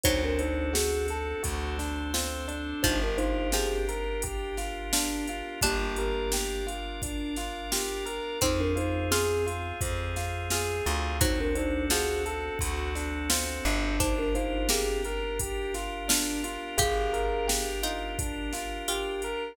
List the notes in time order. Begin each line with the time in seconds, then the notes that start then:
0.03 D2 F#3 C4 D4 D#4 F#4 A4 C5, kick, closed hi-hat
0.24 D4 A#4
0.39 D4 D#4 C5, closed hi-hat
0.73 F#4 G#4, snare
1.08 A4, closed hi-hat
1.43 D2 C4 D4 F#4 A4 C5, kick, closed hi-hat
1.79 D4, snare, closed hi-hat
2.14 C4 F4, snare
2.48 D4, closed hi-hat
2.83 G1 F3 D4 D#4 F4 G4 A#4 C5, kick, closed hi-hat
3.02 D4 A#4
3.18 D#4 F4 C5, closed hi-hat
3.52 F3 C4 G4 G#4, snare
3.89 A#4, closed hi-hat
4.22 G4, kick, closed hi-hat
4.57 F4, snare, closed hi-hat
4.93 D4 F4, snare
5.27 F4, closed hi-hat
5.61 G1 A#3 D4 F4 G4 A#4 D5, kick, closed hi-hat
5.96 A#4, closed hi-hat
6.32 G4, snare
6.67 F4, closed hi-hat
7.02 D4, kick, closed hi-hat
7.36 F4, snare, closed hi-hat
7.72 F4 G4, snare
8.06 A#4, closed hi-hat
8.41 F2 C4 D#4 F4 G#4 C5, kick, closed hi-hat
8.60 D4 A#4
8.75 D#4 F4 C5, closed hi-hat
9.11 C4 F4 G#4, snare
9.46 F4, closed hi-hat
9.81 F2 C4, kick, closed hi-hat
10.16 F4, snare, closed hi-hat
10.50 F4 G#4, snare
10.86 D2 F4, closed hi-hat
11.20 F#3 C4 D4 D#4 F#4 A4 C5, kick, closed hi-hat
11.40 D4 A#4
11.55 D4 D#4 C5, closed hi-hat
11.90 F3 F#4 G#4, snare
12.25 A4, closed hi-hat
12.59 D2 F#4, kick, closed hi-hat
12.95 D4, snare, closed hi-hat
13.30 C4 F4, snare
13.65 G1 D4, closed hi-hat
13.99 D4 D#4 F4 G4 A#4 C5, kick, closed hi-hat
14.19 D4 A#4
14.35 D#4 F4 C5, closed hi-hat
14.69 A#3 C4 G4 G#4, snare
15.04 A#4, closed hi-hat
15.39 G4, kick, closed hi-hat
15.74 F4, snare, closed hi-hat
16.08 D4 F4, snare
16.44 F4, closed hi-hat
16.77 G1 G4 G#4 F5, kick, closed hi-hat
17.13 A#4, closed hi-hat
17.47 G4, snare
17.83 D#4 F4, closed hi-hat
18.19 D4, kick, closed hi-hat
18.53 F4, snare, closed hi-hat
18.88 F4 G4, closed hi-hat
19.22 A#4, closed hi-hat